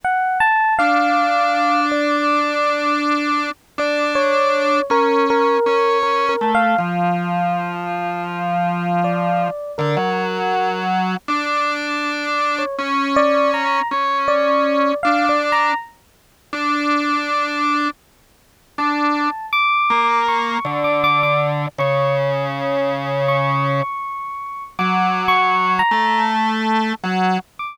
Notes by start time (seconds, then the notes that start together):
0.04 F#5
0.40 A5
0.78 D4 F5
1.91 D5
3.78 D4 D5
4.15 C#5
4.90 C#4 A#4
5.30 A#4
5.66 C#4
6.03 A#4
6.29 A#4
6.41 A3
6.54 F5
6.78 F3
9.04 D5
9.78 D3 A#4
9.97 F#3
11.28 D4
12.58 C#5
12.78 C#4
13.16 D5
13.53 A#5
13.91 C#4
14.28 D5
15.03 D4 F5
15.29 D5
15.52 A#5
16.53 D4
18.78 D4 A5
19.52 D6
19.90 A#3
20.28 C#6
20.65 D3
20.84 D6
21.04 D6
21.23 D6
21.78 C#3 C#6
23.28 C#6
24.79 F#3 D6
25.28 C#6
25.79 A#5
25.91 A3
27.03 F#3
27.59 D6